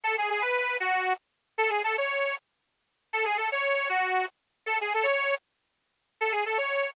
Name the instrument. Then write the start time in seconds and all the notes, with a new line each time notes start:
accordion
0.04 A4
0.18 G#4
0.30 G#4
0.41 B4
0.80 F#4
1.58 A4
1.70 G#4
1.84 A4
1.98 C#5
3.13 A4
3.25 G#4
3.37 A4
3.52 C#5
3.89 F#4
4.66 A4
4.81 G#4
4.94 A4
5.03 C#5
6.21 A4
6.32 G#4
6.46 A4
6.58 C#5